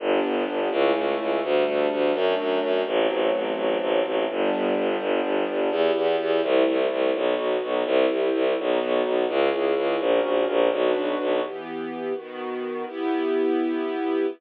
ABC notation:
X:1
M:6/8
L:1/8
Q:3/8=84
K:G
V:1 name="String Ensemble 1"
[B,DG]3 [A,^CE]3 | [G,A,D]3 [F,A,D]3 | [F,A,C]6 | [G,B,D]6 |
[K:Em] [B,EG]3 [A,CE]3 | [B,^DF]3 [CEG]3 | [B,^DF]3 [^CE^G]3 | [^CF^A]3 [DFB]3 |
[E,B,G]3 [^D,B,F]3 | [B,EG]6 |]
V:2 name="Violin" clef=bass
G,,, G,,, G,,, ^C,, C,, C,, | D,, D,, D,, F,, F,, F,, | A,,, A,,, A,,, A,,, A,,, A,,, | G,,, G,,, G,,, G,,, G,,, G,,, |
[K:Em] E,, E,, E,, C,, C,, C,, | B,,, B,,, B,,, C,, C,, C,, | B,,, B,,, B,,, ^C,, C,, C,, | ^A,,, A,,, A,,, B,,, B,,, B,,, |
z6 | z6 |]